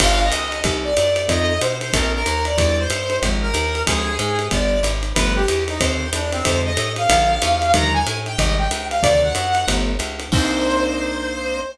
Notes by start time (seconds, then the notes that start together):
0.00 G1 B3 D4 F4 G4 F5, kick, crash, ride
0.22 D#5
0.32 C#2, hi-hat pedal, ride
0.52 ride
0.64 C2 A#3 C4 D#4 G4, kick, ride
0.84 D5
0.97 F#2, hi-hat pedal, ride
1.16 ride
1.28 F2 A3 C4 D#4 F4 D#5, kick, ride
1.61 B2 C5, hi-hat pedal, ride
1.81 C5, ride
1.93 A#1 A3 A#3 C4 D4 A#4, kick, ride
2.14 A#4
2.26 D#2, hi-hat pedal, ride
2.45 D5, ride
2.57 E2 F#3 G3 D4 E4 D5, kick, ride
2.78 C5
2.90 G2, hi-hat pedal, ride
3.10 ride
3.22 G#1 F3 G#3 C4 D#4, kick, ride
3.42 A#4
3.54 D#2, hi-hat pedal, ride
3.75 ride
3.86 D2 F3 G#3 C4 D4 G#4, kick, ride
4.19 G#2 G#4, hi-hat pedal, ride
4.39 ride
4.51 G1 F3 G3 B3 D4 D5, kick, ride
4.83 G#1, hi-hat pedal, ride
5.03 ride
5.14 G1 F3 G3 A3 B3 B4, kick, ride
5.36 G4
5.48 E2, hi-hat pedal, ride
5.68 D#4, ride
5.79 D#2 D3 D#3 A#3 C4 C5, kick, ride
6.13 E2 D4, hi-hat pedal, ride
6.32 C4, ride
6.45 F2 D3 F3 G#3 C4 C5, kick, ride
6.64 D#5
6.77 A2, hi-hat pedal, ride
6.96 F5, ride
7.09 A#1 D3 F3 G#3 A#3, kick, ride
7.42 E2, hi-hat pedal, ride
7.62 ride
7.74 D#2 D3 D#3 F3 G3 A#5, kick, ride
7.93 G#5
8.06 A2, hi-hat pedal, ride
8.26 G5, ride
8.38 G#1 C3 D#3 G3 G#3 D#5, kick, ride
8.58 G5
8.71 C#2, hi-hat pedal, ride
8.90 F5, ride
9.02 D2 C3 D3 D#3 F#3 D5, kick, ride
9.22 F#5
9.35 F#2, hi-hat pedal, ride
9.55 ride
9.68 G1 F3 G3 A3 B3, kick, ride
9.99 C#2, hi-hat pedal, ride
10.20 ride
10.32 C2 A#3 C4 D4 D#4 C5, kick, crash